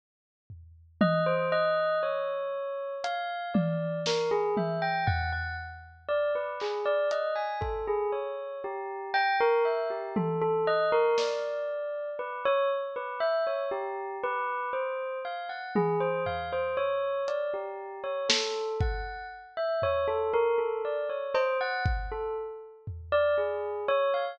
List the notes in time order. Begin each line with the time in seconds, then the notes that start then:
0.50 floor tom
1.01 D#5, high tom
1.26 C5
1.52 D#5
2.03 C#5
3.04 F5, closed hi-hat
3.54 D5, high tom
4.06 A#4, snare
4.31 G#4
4.57 E5, high tom
4.82 G5
5.07 F#5, floor tom
5.32 F#5
6.08 D5
6.35 B4
6.60 G#4, clap
6.86 D5
7.11 D#5, closed hi-hat
7.36 G#5
7.61 A4, kick
7.87 G#4
8.12 C#5
8.64 G4
9.14 G5, cowbell
9.40 A#4
9.65 E5
9.90 G4
10.16 A4, high tom
10.42 A4
10.67 D#5
10.92 A#4
11.18 D5, snare
12.19 B4
12.45 C#5
12.96 B4
13.20 E5
13.47 C#5
13.71 G4
14.24 B4
14.73 C5
15.25 F5
15.49 F#5
15.75 G#4, high tom
16.00 C5
16.26 F5, floor tom
16.53 C5
16.77 C#5
17.28 D5, closed hi-hat
17.54 G4
18.04 C#5
18.29 A4, snare
18.81 F#5, kick
19.57 E5
19.82 C#5, floor tom
20.08 A4
20.33 A#4
20.58 A4
20.85 D5
21.10 C#5
21.34 C5, cowbell
21.61 F#5
21.86 kick
22.12 A4
22.87 floor tom
23.12 D5
23.38 G#4
23.88 C#5
24.14 F5